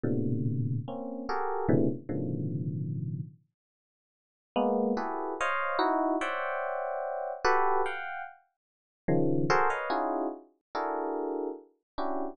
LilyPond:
\new Staff { \time 5/8 \tempo 4 = 73 <a, ais, b, c d>4 <ais c' cis'>8 <fis' g' gis' a' ais'>8 <a, b, c cis d e>16 r16 | <a, b, cis d dis f>4. r4 | r8 <gis ais b>8 <e' fis' g' gis' a' b'>8 <c'' cis'' dis'' f''>8 <dis' e' fis'>8 | <c'' cis'' d'' e'' fis'' g''>4. <fis' g' a' b'>8 <f'' fis'' g''>8 |
r4 <cis dis f>8 <fis' gis' a' ais' c''>16 <b' cis'' dis'' f''>16 <cis' dis' e' f' fis' gis'>8 | r8 <d' e' fis' gis' a' ais'>4 r8 <cis' d' e' fis' g'>8 | }